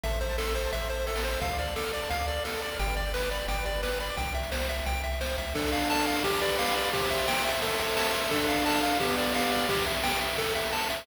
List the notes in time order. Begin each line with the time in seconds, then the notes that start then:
0.03 A1 A4 E5, kick, closed hi-hat
0.11 C5, closed hi-hat
0.20 C5 E5, closed hi-hat
0.29 A5, closed hi-hat
0.38 A4 C6, snare
0.47 E6, closed hi-hat
0.55 C5 C6, closed hi-hat
0.64 A5, closed hi-hat
0.72 A1 E5, kick, closed hi-hat
0.81 C5, closed hi-hat
0.90 A4 C5, closed hi-hat
0.98 C5, closed hi-hat
1.07 A4 E5, closed hi-hat
1.16 A5, snare
1.24 C5 C6, closed hi-hat
1.32 E6, closed hi-hat
1.41 D2 A4 F5, kick, closed hi-hat
1.50 D5, closed hi-hat
1.58 D5 F5, closed hi-hat
1.67 A5, closed hi-hat
1.76 A4 D6, snare
1.83 F6, closed hi-hat
1.93 D5 D6, closed hi-hat
2.02 A5, closed hi-hat
2.09 D2 F5, kick, closed hi-hat
2.19 D5, closed hi-hat
2.28 A4 D5, closed hi-hat
2.36 D5, closed hi-hat
2.44 A4 F5, snare
2.54 A5, closed hi-hat
2.62 D5 D6, closed hi-hat
2.71 F6, open hi-hat
2.79 G1 G4 G5, kick, closed hi-hat
2.88 B4, closed hi-hat
2.97 D5, closed hi-hat
3.05 G5, closed hi-hat
3.14 B4 B5, snare
3.21 D6, closed hi-hat
3.31 D5 B5, closed hi-hat
3.40 G5, closed hi-hat
3.48 G1 D5 G5, kick, closed hi-hat
3.57 B4, closed hi-hat
3.65 G4 D5, closed hi-hat
3.74 B4, closed hi-hat
3.82 B4 D5, snare
3.91 G5, closed hi-hat
4.00 D5 B5, closed hi-hat
4.09 D6, closed hi-hat
4.17 C2 G5, kick, closed hi-hat
4.26 closed hi-hat
4.34 E5, closed hi-hat
4.43 closed hi-hat
4.52 C5, snare
4.60 closed hi-hat
4.69 E5, closed hi-hat
4.78 closed hi-hat
4.86 C2 G5, kick, closed hi-hat
4.95 closed hi-hat
5.04 E5, closed hi-hat
5.12 closed hi-hat
5.20 C2 C5, snare
5.29 closed hi-hat
5.38 C#2 E5, closed hi-hat
5.47 closed hi-hat
5.55 D4 A4, kick, crash
5.64 ride
5.72 A4 F5, ride
5.81 ride
5.90 F5 A5, snare
5.98 ride
6.07 D4 F5, ride
6.16 ride
6.24 G4, kick, ride
6.33 ride
6.41 B4 D5, ride
6.50 ride
6.59 D5 F5, snare
6.67 ride
6.76 D5 F5, ride
6.85 ride
6.93 G4 C5, kick, ride
7.02 ride
7.10 E5, ride
7.19 ride
7.27 G5, snare
7.36 ride
7.45 C5 E5, ride
7.54 ride
7.62 A4, kick, ride
7.71 ride
7.78 C5 E5, ride
7.88 ride
7.97 E5 A5, snare
8.05 ride
8.14 A4 E5, ride
8.22 ride
8.31 D4 A4, kick, ride
8.40 ride
8.47 A4 F5, ride
8.57 ride
8.66 F5 A5, snare
8.74 ride
8.81 D4 F5, ride
8.91 ride
9.00 B3 G4, kick, ride
9.09 ride
9.17 G4 D5, ride
9.26 ride
9.35 D5 F5, snare
9.43 ride
9.52 D5 F5, ride
9.60 ride
9.69 G4, kick, ride
9.78 ride
9.86 E5, ride
9.95 ride
10.04 G5, snare
10.12 ride
10.21 E5, ride
10.29 ride
10.38 A4, kick, ride
10.47 ride
10.55 E5, ride
10.64 ride
10.72 A5, snare
10.81 ride
10.90 E5, ride
10.98 ride